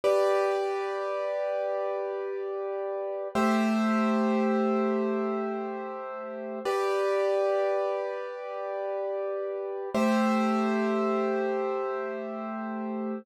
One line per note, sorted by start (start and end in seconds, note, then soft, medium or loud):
0.04 3.28 G4 medium
0.04 3.28 B4 medium
0.04 3.28 D5 medium
3.35 6.59 A3 medium
3.35 6.59 G4 medium
3.35 6.59 C5 medium
3.35 6.59 E5 medium
6.65 9.89 G4 medium
6.65 9.89 B4 medium
6.65 9.89 D5 medium
9.94 13.19 A3 medium
9.94 13.19 G4 medium
9.94 13.19 C5 medium
9.94 13.19 E5 medium